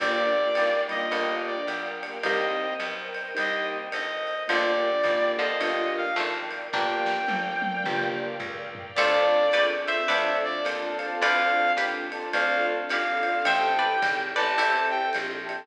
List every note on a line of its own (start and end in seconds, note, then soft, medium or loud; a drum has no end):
0.00 0.50 G1 loud
0.00 0.23 A#3 loud
0.00 0.23 D4 medium
0.00 0.23 F4 medium
0.00 0.23 G4 medium
0.00 0.53 G4 medium
0.00 0.53 A#4 medium
0.00 1.11 A#4 medium
0.00 0.79 D5 medium
0.00 1.11 D5 medium
0.00 1.11 F5 medium
0.00 1.11 G5 medium
0.00 kick medium
0.00 crash medium
0.00 ride loud
0.35 0.71 A#3 medium
0.35 0.71 D4 medium
0.35 0.71 F4 medium
0.35 0.71 G4 medium
0.55 1.09 G#1 medium
0.55 0.88 G3 medium
0.55 0.89 A#3 medium
0.55 hi-hat pedal medium
0.55 ride medium
0.89 1.10 D#3 medium
0.89 1.10 G3 medium
0.89 1.56 A#3 medium
0.89 1.56 D4 medium
0.89 1.56 F4 medium
0.89 1.56 G4 medium
0.89 1.35 D#5 medium
0.89 ride medium
1.11 1.63 G1 medium
1.11 2.19 G3 medium
1.11 2.19 A#3 medium
1.11 2.23 A#4 medium
1.11 2.24 D5 medium
1.11 2.24 F5 medium
1.11 2.23 G5 medium
1.11 ride medium
1.46 1.66 D5 medium
1.67 2.19 B1 medium
1.67 hi-hat pedal medium
1.67 ride medium
2.03 2.19 A#3 medium
2.03 2.19 D4 medium
2.03 2.19 F4 medium
2.03 2.19 G4 medium
2.03 ride medium
2.23 2.75 C2 loud
2.23 3.08 G3 loud
2.23 2.68 A#3 medium
2.23 3.08 A#3 loud
2.23 2.68 C4 medium
2.23 2.68 D#4 medium
2.23 2.68 G4 medium
2.23 3.35 A#4 medium
2.23 3.35 C5 medium
2.23 2.74 D#5 medium
2.23 3.35 D#5 medium
2.23 3.35 G5 medium
2.23 kick medium
2.23 ride loud
2.80 3.31 B1 medium
2.80 hi-hat pedal medium
2.80 ride medium
3.14 ride medium
3.35 3.89 C2 loud
3.35 3.78 A#3 medium
3.35 3.78 C4 medium
3.35 3.78 D#4 medium
3.35 3.78 G4 medium
3.35 4.46 A#4 medium
3.35 4.46 C5 medium
3.35 4.46 D#5 medium
3.35 4.46 G5 medium
3.35 ride loud
3.39 3.67 D#5 medium
3.92 4.45 G1 medium
3.92 4.43 D#5 medium
3.92 hi-hat pedal medium
3.92 ride medium
4.27 ride medium
4.48 5.02 G1 loud
4.48 5.34 D3 medium
4.48 5.34 F3 loud
4.48 4.91 A#3 medium
4.48 4.91 D4 medium
4.48 4.91 F4 medium
4.48 4.91 G4 medium
4.48 5.61 A#4 medium
4.48 5.61 D5 medium
4.48 5.31 D5 medium
4.48 5.61 F5 medium
4.48 5.61 G5 medium
4.48 ride loud
5.04 5.55 G#1 medium
5.04 5.47 A#3 medium
5.04 5.47 D4 medium
5.04 5.47 F4 medium
5.04 5.47 G4 medium
5.04 kick medium
5.04 hi-hat pedal medium
5.04 ride medium
5.39 6.07 D3 medium
5.39 6.07 F3 medium
5.39 5.93 D#5 medium
5.39 ride medium
5.60 6.12 G1 loud
5.60 6.04 A#3 medium
5.60 6.04 D4 medium
5.60 6.04 F4 loud
5.60 6.04 G4 medium
5.60 6.73 A#4 medium
5.60 6.73 D5 medium
5.60 6.73 F5 medium
5.60 6.73 G5 medium
5.60 ride loud
5.97 6.17 F5 medium
6.16 6.69 G#1 medium
6.16 6.69 F3 medium
6.16 6.69 A3 medium
6.16 hi-hat pedal medium
6.16 ride medium
6.51 ride medium
6.73 7.25 G1 loud
6.73 7.22 A#3 medium
6.73 7.18 A#3 medium
6.73 7.22 D4 medium
6.73 7.18 D4 medium
6.73 7.18 F4 medium
6.73 7.18 G4 medium
6.73 7.84 A#4 medium
6.73 7.84 D5 medium
6.73 7.84 F5 medium
6.73 8.10 G5 medium
6.73 7.84 G5 medium
6.73 kick medium
6.73 snare medium
7.06 snare medium
7.28 7.80 G1 medium
7.28 high tom medium
7.62 high tom medium
7.84 8.37 G1 loud
7.84 8.29 A#3 medium
7.84 8.29 D4 medium
7.84 8.29 F4 loud
7.84 8.29 G4 medium
7.84 8.95 A#4 medium
7.84 8.95 D5 medium
7.84 8.95 F5 medium
7.84 8.95 G5 medium
7.84 mid tom loud
8.40 8.91 C#2 loud
8.40 floor tom loud
8.75 floor tom loud
8.95 9.49 D2 loud
8.95 10.09 C4 medium
8.95 10.09 D4 medium
8.95 9.49 F4 medium
8.95 10.09 F4 medium
8.95 9.49 A4 loud
8.95 10.09 A4 medium
8.95 9.42 C5 medium
8.95 9.66 D5 medium
8.95 9.42 D5 medium
8.95 9.42 F5 medium
8.95 9.42 A5 loud
8.95 crash loud
8.95 ride loud
9.52 10.05 C#2 medium
9.52 9.87 B4 medium
9.52 9.87 D5 loud
9.52 hi-hat pedal medium
9.52 ride loud
9.86 10.07 C5 medium
9.86 10.39 E5 medium
9.86 10.07 E5 medium
9.86 ride medium
10.08 10.61 D2 loud
10.08 11.21 C4 medium
10.08 11.21 D4 medium
10.08 11.21 F4 medium
10.08 11.21 A4 medium
10.08 11.13 B4 medium
10.08 10.53 C5 medium
10.08 11.13 D5 loud
10.08 10.53 D5 loud
10.08 10.53 F5 medium
10.08 10.53 A5 loud
10.08 ride loud
10.44 10.65 D5 medium
10.65 11.17 D#2 loud
10.65 10.98 C5 medium
10.65 10.98 D5 medium
10.65 10.98 F5 medium
10.65 10.98 A5 medium
10.65 hi-hat pedal loud
10.65 ride loud
10.99 11.64 C5 loud
10.99 11.64 D5 loud
10.99 11.64 F5 loud
10.99 11.64 A5 medium
10.99 ride medium
11.21 11.73 D2 loud
11.21 12.33 C4 medium
11.21 12.33 D4 medium
11.21 12.33 F4 medium
11.21 12.33 A4 medium
11.21 11.75 B4 loud
11.21 11.75 D5 loud
11.21 11.72 F5 medium
11.21 ride loud
11.77 12.28 D#2 medium
11.77 12.73 G4 medium
11.77 12.73 B4 medium
11.77 hi-hat pedal medium
11.77 ride medium
12.12 12.29 C5 medium
12.12 12.29 D5 medium
12.12 12.29 F5 medium
12.12 12.29 A5 medium
12.12 ride medium
12.33 12.85 D2 loud
12.33 13.44 C4 medium
12.33 13.45 D4 medium
12.33 13.45 F4 medium
12.33 13.44 A4 medium
12.33 12.77 C5 loud
12.33 12.77 D5 loud
12.33 12.66 F5 medium
12.33 12.77 F5 medium
12.33 12.77 A5 medium
12.33 ride loud
12.89 13.43 G#1 medium
12.89 13.45 G4 medium
12.89 13.45 B4 medium
12.89 13.45 F5 medium
12.89 hi-hat pedal medium
12.89 ride loud
13.23 13.38 C5 medium
13.23 13.38 D5 medium
13.23 13.38 F5 medium
13.23 13.38 A5 medium
13.23 ride medium
13.45 13.97 A1 loud
13.45 14.56 C4 medium
13.45 14.56 E4 medium
13.45 14.56 G4 medium
13.45 14.56 A4 medium
13.45 13.88 C5 medium
13.45 13.75 C5 loud
13.45 13.88 E5 medium
13.45 13.75 E5 loud
13.45 13.88 G5 medium
13.45 14.19 G5 medium
13.45 13.88 A5 loud
13.45 ride loud
13.79 14.22 B4 medium
13.79 14.22 D5 medium
14.02 14.34 G#1 loud
14.02 kick medium
14.02 hi-hat pedal loud
14.02 ride loud
14.36 15.11 A1 loud
14.36 14.55 B4 medium
14.36 14.55 D5 loud
14.36 14.86 A5 medium
14.36 ride medium
14.57 15.67 C4 medium
14.57 15.67 E4 medium
14.57 15.59 E4 medium
14.57 15.67 G4 medium
14.57 15.59 G4 medium
14.57 15.67 A4 medium
14.57 15.00 C5 medium
14.57 15.00 E5 loud
14.57 15.00 G5 medium
14.57 15.00 A5 medium
14.57 ride loud
14.90 15.10 G5 medium
15.13 15.67 A#1 medium
15.13 hi-hat pedal loud
15.13 ride medium
15.46 15.62 C5 medium
15.46 15.62 E5 medium
15.46 15.62 G5 medium
15.46 15.62 A5 medium
15.46 ride medium